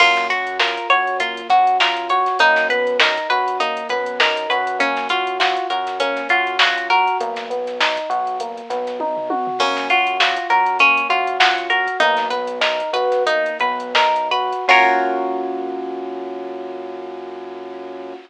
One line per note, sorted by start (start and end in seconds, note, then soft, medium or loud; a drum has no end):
0.00 0.78 F#2 loud
0.00 0.28 A#3 medium
0.00 0.27 F4 loud
0.00 kick loud
0.00 crash loud
0.17 snare medium
0.17 closed hi-hat medium
0.30 0.57 F#4 medium
0.30 0.58 F#4 medium
0.30 closed hi-hat medium
0.47 closed hi-hat medium
0.59 0.87 F4 medium
0.59 0.87 A#4 medium
0.59 snare loud
0.77 closed hi-hat medium
0.90 1.42 F#2 medium
0.90 1.18 F#4 medium
0.90 1.17 C#5 loud
0.90 closed hi-hat medium
1.07 closed hi-hat medium
1.20 1.48 A#3 medium
1.20 1.48 F4 loud
1.20 kick loud
1.20 closed hi-hat loud
1.37 closed hi-hat medium
1.49 2.28 F#2 medium
1.49 1.77 F#4 medium
1.49 1.78 F#4 medium
1.49 kick loud
1.49 closed hi-hat medium
1.67 closed hi-hat medium
1.80 2.08 F4 medium
1.80 2.08 A#4 medium
1.80 snare loud
1.97 closed hi-hat medium
2.10 2.38 F#4 medium
2.10 2.37 C#5 medium
2.10 kick loud
2.10 closed hi-hat medium
2.26 snare soft
2.26 closed hi-hat medium
2.39 3.18 F#2 loud
2.39 2.67 A#3 medium
2.39 2.68 D#4 loud
2.39 kick loud
2.39 closed hi-hat loud
2.56 snare medium
2.56 closed hi-hat medium
2.69 2.97 B3 medium
2.69 2.98 B4 medium
2.69 closed hi-hat loud
2.87 closed hi-hat medium
3.00 3.27 D#4 medium
3.00 3.27 A#4 medium
3.00 snare loud
3.17 kick medium
3.17 closed hi-hat medium
3.30 3.83 F#2 medium
3.30 3.58 F#4 medium
3.30 3.57 B4 medium
3.30 closed hi-hat medium
3.48 closed hi-hat medium
3.60 3.88 A#3 medium
3.60 3.88 D#4 loud
3.60 kick loud
3.60 closed hi-hat loud
3.77 closed hi-hat medium
3.89 4.47 F#2 medium
3.89 4.17 B3 medium
3.89 4.17 B4 loud
3.89 kick medium
3.89 closed hi-hat medium
4.06 closed hi-hat medium
4.20 4.48 D#4 medium
4.20 4.48 A#4 medium
4.20 snare loud
4.37 closed hi-hat medium
4.49 5.58 F#2 loud
4.49 4.78 F#4 medium
4.49 4.77 B4 medium
4.49 closed hi-hat medium
4.67 closed hi-hat medium
4.79 5.07 A#3 medium
4.79 5.08 C#4 loud
4.79 kick loud
4.79 closed hi-hat loud
4.97 snare medium
4.97 closed hi-hat medium
5.09 5.37 F4 medium
5.09 5.38 F#4 medium
5.09 snare soft
5.09 closed hi-hat loud
5.27 closed hi-hat medium
5.40 5.67 F4 medium
5.40 5.67 F#4 medium
5.40 snare loud
5.57 closed hi-hat medium
5.70 6.22 F#2 medium
5.70 5.98 F#4 medium
5.70 5.98 A#4 medium
5.70 closed hi-hat medium
5.87 snare soft
5.87 closed hi-hat medium
6.00 6.28 A#3 medium
6.00 6.27 C#4 loud
6.00 kick loud
6.00 closed hi-hat loud
6.17 snare soft
6.17 closed hi-hat medium
6.29 7.08 F#2 medium
6.29 6.57 F4 medium
6.29 6.58 F#4 medium
6.29 kick medium
6.29 closed hi-hat medium
6.47 closed hi-hat medium
6.59 6.88 F4 medium
6.59 6.87 F#4 loud
6.59 snare loud
6.78 closed hi-hat medium
6.90 7.18 F#4 medium
6.90 7.17 A#4 medium
6.90 kick medium
6.90 closed hi-hat medium
7.08 closed hi-hat medium
7.21 7.99 B1 loud
7.21 7.48 A#3 loud
7.21 kick loud
7.21 closed hi-hat loud
7.36 snare medium
7.36 closed hi-hat medium
7.50 7.78 B3 medium
7.50 closed hi-hat medium
7.67 snare soft
7.67 closed hi-hat medium
7.80 8.08 D#4 medium
7.80 snare loud
7.97 kick loud
7.97 closed hi-hat medium
8.10 8.62 B1 loud
8.10 8.37 F#4 medium
8.10 closed hi-hat medium
8.27 closed hi-hat medium
8.40 8.68 A#3 medium
8.40 kick loud
8.40 closed hi-hat loud
8.58 closed hi-hat medium
8.70 9.48 B1 medium
8.70 8.97 B3 medium
8.70 kick medium
8.70 snare soft
8.70 closed hi-hat loud
8.87 snare soft
8.87 closed hi-hat medium
9.00 9.28 D#4 medium
9.00 kick medium
9.00 high tom medium
9.17 floor tom loud
9.30 9.58 F#4 medium
9.30 high tom loud
9.47 floor tom loud
9.59 10.38 F#2 loud
9.59 9.88 A#3 medium
9.59 9.88 C#4 loud
9.59 kick loud
9.59 crash loud
9.77 snare medium
9.77 closed hi-hat medium
9.90 10.17 F4 medium
9.90 10.18 F#4 medium
9.90 closed hi-hat medium
10.07 closed hi-hat medium
10.20 10.48 F4 medium
10.20 10.47 F#4 medium
10.20 snare loud
10.37 closed hi-hat medium
10.50 11.02 F#2 medium
10.50 10.77 F#4 medium
10.50 10.78 A#4 medium
10.50 closed hi-hat medium
10.66 closed hi-hat medium
10.79 11.07 A#3 medium
10.79 11.08 C#4 loud
10.79 kick medium
10.79 closed hi-hat loud
10.97 closed hi-hat medium
11.09 11.88 F#2 medium
11.09 11.38 F4 medium
11.09 11.37 F#4 medium
11.09 kick loud
11.09 closed hi-hat medium
11.27 closed hi-hat medium
11.40 11.68 F4 medium
11.40 11.67 F#4 medium
11.40 snare loud
11.58 closed hi-hat medium
11.70 11.98 F#4 medium
11.70 11.97 A#4 medium
11.70 closed hi-hat medium
11.87 kick loud
11.87 closed hi-hat medium
12.00 12.81 B1 loud
12.00 12.28 A#3 loud
12.00 12.28 D#4 loud
12.00 kick loud
12.00 closed hi-hat loud
12.17 snare medium
12.17 closed hi-hat medium
12.30 12.59 B3 medium
12.30 12.59 B4 medium
12.30 snare soft
12.30 closed hi-hat medium
12.47 closed hi-hat medium
12.61 12.90 D#4 medium
12.61 12.91 A#4 medium
12.61 snare loud
12.80 kick medium
12.80 closed hi-hat medium
12.92 13.51 B1 medium
12.92 13.23 F#4 medium
12.92 13.24 B4 loud
12.92 closed hi-hat medium
13.12 snare soft
13.12 closed hi-hat medium
13.27 13.58 A#3 medium
13.27 13.58 D#4 loud
13.27 kick loud
13.27 closed hi-hat loud
13.46 closed hi-hat medium
13.59 14.53 B1 loud
13.59 13.93 B3 medium
13.59 13.92 B4 medium
13.59 kick loud
13.59 closed hi-hat medium
13.80 closed hi-hat medium
13.95 14.28 D#4 medium
13.95 14.28 A#4 medium
13.95 snare loud
14.16 closed hi-hat medium
14.31 14.65 F#4 medium
14.31 14.65 B4 medium
14.31 closed hi-hat medium
14.53 closed hi-hat medium
14.68 18.13 F#2 loud
14.68 18.14 A#3 medium
14.68 18.14 C#4 loud
14.68 18.14 F4 loud
14.68 18.14 F4 medium
14.68 18.14 F#4 loud
14.68 18.14 A#4 loud
14.68 18.14 C#5 loud
14.68 kick loud
14.68 crash loud